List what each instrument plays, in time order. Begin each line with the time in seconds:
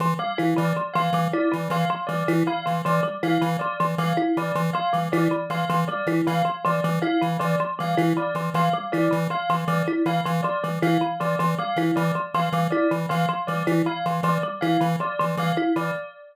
0.00 lead 1 (square) E3, kalimba F3
0.19 kalimba G3, tubular bells F5
0.38 lead 1 (square) E3, kalimba E4
0.56 kalimba E3, lead 1 (square) E3, tubular bells D5
0.77 kalimba F3
0.94 lead 1 (square) E3, kalimba F3, tubular bells F5
1.13 lead 1 (square) E3, kalimba G3
1.33 kalimba E4, tubular bells D5
1.52 kalimba E3, lead 1 (square) E3
1.70 lead 1 (square) E3, kalimba F3, tubular bells F5
1.90 kalimba F3
2.07 lead 1 (square) E3, kalimba G3, tubular bells D5
2.28 lead 1 (square) E3, kalimba E4
2.47 kalimba E3, tubular bells F5
2.66 lead 1 (square) E3, kalimba F3
2.85 lead 1 (square) E3, kalimba F3, tubular bells D5
3.03 kalimba G3
3.23 lead 1 (square) E3, kalimba E4, tubular bells F5
3.41 kalimba E3, lead 1 (square) E3
3.59 kalimba F3, tubular bells D5
3.80 lead 1 (square) E3, kalimba F3
3.98 lead 1 (square) E3, kalimba G3, tubular bells F5
4.17 kalimba E4
4.37 lead 1 (square) E3, kalimba E3, tubular bells D5
4.55 lead 1 (square) E3, kalimba F3
4.73 kalimba F3, tubular bells F5
4.93 lead 1 (square) E3, kalimba G3
5.12 lead 1 (square) E3, kalimba E4, tubular bells D5
5.31 kalimba E3
5.50 lead 1 (square) E3, kalimba F3, tubular bells F5
5.69 lead 1 (square) E3, kalimba F3
5.88 kalimba G3, tubular bells D5
6.07 lead 1 (square) E3, kalimba E4
6.27 kalimba E3, lead 1 (square) E3, tubular bells F5
6.45 kalimba F3
6.65 lead 1 (square) E3, kalimba F3, tubular bells D5
6.84 lead 1 (square) E3, kalimba G3
7.02 kalimba E4, tubular bells F5
7.21 kalimba E3, lead 1 (square) E3
7.39 lead 1 (square) E3, kalimba F3, tubular bells D5
7.60 kalimba F3
7.79 lead 1 (square) E3, kalimba G3, tubular bells F5
7.97 lead 1 (square) E3, kalimba E4
8.17 kalimba E3, tubular bells D5
8.35 lead 1 (square) E3, kalimba F3
8.54 lead 1 (square) E3, kalimba F3, tubular bells F5
8.73 kalimba G3
8.92 lead 1 (square) E3, kalimba E4, tubular bells D5
9.11 kalimba E3, lead 1 (square) E3
9.30 kalimba F3, tubular bells F5
9.49 lead 1 (square) E3, kalimba F3
9.68 lead 1 (square) E3, kalimba G3, tubular bells D5
9.88 kalimba E4
10.06 lead 1 (square) E3, kalimba E3, tubular bells F5
10.25 lead 1 (square) E3, kalimba F3
10.43 kalimba F3, tubular bells D5
10.64 lead 1 (square) E3, kalimba G3
10.82 lead 1 (square) E3, kalimba E4, tubular bells F5
11.01 kalimba E3
11.20 lead 1 (square) E3, kalimba F3, tubular bells D5
11.39 lead 1 (square) E3, kalimba F3
11.58 kalimba G3, tubular bells F5
11.76 lead 1 (square) E3, kalimba E4
11.96 kalimba E3, lead 1 (square) E3, tubular bells D5
12.15 kalimba F3
12.34 lead 1 (square) E3, kalimba F3, tubular bells F5
12.52 lead 1 (square) E3, kalimba G3
12.70 kalimba E4, tubular bells D5
12.91 kalimba E3, lead 1 (square) E3
13.09 lead 1 (square) E3, kalimba F3, tubular bells F5
13.29 kalimba F3
13.47 lead 1 (square) E3, kalimba G3, tubular bells D5
13.67 lead 1 (square) E3, kalimba E4
13.86 kalimba E3, tubular bells F5
14.06 lead 1 (square) E3, kalimba F3
14.23 lead 1 (square) E3, kalimba F3, tubular bells D5
14.43 kalimba G3
14.61 lead 1 (square) E3, kalimba E4, tubular bells F5
14.81 kalimba E3, lead 1 (square) E3
15.00 kalimba F3, tubular bells D5
15.19 lead 1 (square) E3, kalimba F3
15.37 lead 1 (square) E3, kalimba G3, tubular bells F5
15.57 kalimba E4
15.76 kalimba E3, lead 1 (square) E3, tubular bells D5